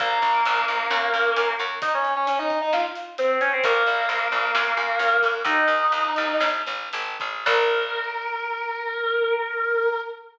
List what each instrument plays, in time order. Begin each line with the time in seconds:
0.00 electric bass (finger) A#1, distortion guitar A#3 A#4, kick, closed hi-hat
0.22 electric bass (finger) A#1, kick, closed hi-hat
0.45 electric bass (finger) A#1, closed hi-hat
0.68 electric bass (finger) A#1, closed hi-hat
0.90 electric bass (finger) F#2, snare
1.14 electric bass (finger) F#2, closed hi-hat
1.36 electric bass (finger) F#2, closed hi-hat
1.59 electric bass (finger) F#2, closed hi-hat
1.82 distortion guitar D#4 D#5, kick, closed hi-hat
1.94 distortion guitar C#4 C#5
2.05 closed hi-hat
2.16 distortion guitar C#4 C#5
2.27 distortion guitar C#4 C#5, closed hi-hat
2.39 distortion guitar D#4 D#5
2.50 kick, closed hi-hat
2.61 distortion guitar D#4 D#5
2.73 distortion guitar F4 F5, snare
2.95 closed hi-hat
3.18 distortion guitar C4 C5, closed hi-hat
3.41 distortion guitar C#4 C#5, closed hi-hat
3.53 distortion guitar C4 C5
3.64 electric bass (finger) A#1, distortion guitar A#3 A#4, kick, closed hi-hat
3.86 electric bass (finger) A#1, closed hi-hat
4.09 electric bass (finger) A#1, closed hi-hat
4.32 electric bass (finger) A#1, closed hi-hat
4.55 electric bass (finger) F#2, snare
4.77 electric bass (finger) F#2, closed hi-hat
4.99 electric bass (finger) F#2, closed hi-hat
5.23 electric bass (finger) F#2, kick, closed hi-hat
5.45 electric bass (finger) D#2, distortion guitar D#4 D#5, kick, closed hi-hat
5.68 electric bass (finger) D#2, closed hi-hat
5.92 electric bass (finger) D#2, closed hi-hat
6.16 electric bass (finger) D#2, closed hi-hat
6.40 electric bass (finger) A1, snare
6.66 electric bass (finger) A1, closed hi-hat
6.93 electric bass (finger) G#1, closed hi-hat
7.20 electric bass (finger) A1, kick, closed hi-hat
7.46 electric bass (finger) A#1, distortion guitar A#4, kick, crash